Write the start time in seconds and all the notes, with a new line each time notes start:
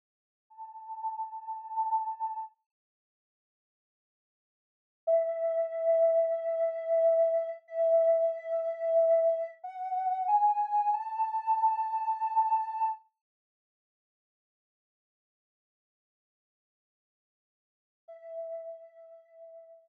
0.50 A5
5.07 E5
7.68 E5
9.64 F#5
10.28 G#5
10.93 A5
18.08 E5